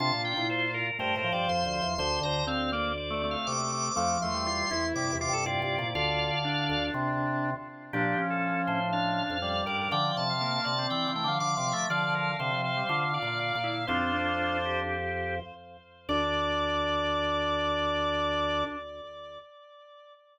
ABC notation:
X:1
M:4/4
L:1/16
Q:1/4=121
K:Dm
V:1 name="Drawbar Organ"
a2 g2 c2 B2 (3B2 B2 d2 c'2 c'2 | c'2 b2 f2 d2 (3d2 d2 f2 d'2 d'2 | d'2 c'6 d'2 d'2 d4 | [df]8 z8 |
G3 A3 c2 f6 d2 | g2 a6 g2 g2 d'4 | d2 B2 c2 c4 d6 | "^rit." [DF]6 G6 z4 |
d16 |]
V:2 name="Drawbar Organ"
F8 c8 | c2 c2 C2 B,2 z A, A,4 A,2 | A,2 A,2 F2 E4 F A F4 | F4 D10 z2 |
D2 ^C6 D4 d2 B B | d3 f3 d4 z f (3f2 f2 e2 | f2 f2 f2 f4 f f f4 | "^rit." c8 z8 |
d16 |]
V:3 name="Drawbar Organ"
D3 E3 z2 A,2 F,6 | D,4 z8 C,4 | F,3 G,3 z2 C,2 C,6 | D,8 z8 |
F,12 G,4 | F,4 B,3 C3 A, F, F,2 F,2 | D,4 D, F,2 G, F2 F4 E2 | "^rit." C2 D6 z8 |
D16 |]
V:4 name="Drawbar Organ"
C, B,,2 B,,5 (3G,,2 A,,2 G,,2 (3F,,2 D,,2 E,,2 | D,,2 D,,10 z4 | F,,2 E,,4 E,,2 (3G,,2 E,,2 G,,2 (3G,,2 G,,2 B,,2 | D,,3 z3 D,,2 C,6 z2 |
B,,2 z4 A,,5 F,,3 G,,2 | D,2 C,4 C,2 (3E,2 E,2 D,2 (3D,2 C,2 A,2 | F,4 C,4 (3D,4 B,,4 B,,4 | "^rit." F,,12 z4 |
D,,16 |]